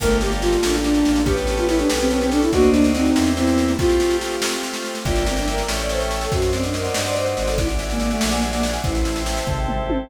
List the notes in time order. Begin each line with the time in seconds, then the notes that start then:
0.00 G1 A3 A#3 F4 G4 A4 A#4, kick, snare, crash
0.10 snare
0.21 A3 G4, snare
0.31 G3, snare
0.42 G3 F4, snare
0.52 snare
0.63 A1 A#3 D4 F4 G4 A4, snare
0.74 snare
0.84 D4, snare
0.94 snare
1.05 A1, snare
1.16 snare
1.26 B3 C#4 G4 A4 B4, kick, snare
1.37 snare
1.47 snare
1.58 F4, snare
1.68 E4, snare
1.79 D4, snare
1.89 B1 B3 C#4 G4 A4, snare
2.00 C4, snare
2.10 C4, snare
2.21 C4, snare
2.31 D4 A4, snare
2.42 E4, snare
2.52 D2 A#3 C4 D4 D#4 F#4, kick, snare
2.63 snare
2.73 D4, snare
2.84 snare
2.94 C4 D#4, snare
3.05 snare
3.16 E2 A#3 C4 E4 G4, snare
3.26 snare
3.37 C4 E4, snare
3.47 snare
3.58 snare
3.68 snare
3.79 A3 C4 F4 G4, kick, snare
3.89 snare
4.00 G4, snare
4.10 snare
4.21 snare
4.32 snare
4.42 A3 C4 F4 G4, snare
4.53 snare
4.63 snare
4.74 snare
4.85 snare
4.95 snare
5.05 G1 A#3 D4 E4 F4 G4 A#4 D5 E5 G5, kick, snare
5.16 snare
5.26 C4, snare
5.37 D4, snare
5.47 A#4, snare
5.58 snare
5.68 A1 A3 C#4 E4 G4 A4 C#5 E5 G5, snare
5.79 D5, snare
5.89 C5, snare
6.00 snare
6.11 snare
6.21 A4, snare
6.31 F#2 C4 F#4 C5 D5 D#5 F#5, kick, snare
6.42 snare
6.53 C4 D4, snare
6.63 D4, snare
6.74 D#4 A#4, snare
6.84 snare
6.94 G2 F#4, snare
7.05 D5, snare
7.16 C4 C5, snare
7.26 snare
7.37 G#1 D4, snare
7.47 A4, snare
7.57 D4 E4 D5 E5 F#5 G#5, kick, snare
7.69 snare
7.79 E4, snare
7.90 A#3, snare
8.00 A#3 F#4, snare
8.10 A3, snare
8.21 A#1 G#4, snare
8.31 A#3, snare
8.42 G3 D4, snare
8.53 A#3, snare
8.63 E4, snare
8.73 snare
8.84 A1 C4 E4 C5 E5 G5 A5, kick, snare
8.95 snare
9.05 E4, snare
9.16 snare
9.26 G4, snare
9.37 snare
9.47 G#1 A4, kick, floor tom
9.68 C4, mid tom
9.89 E4, high tom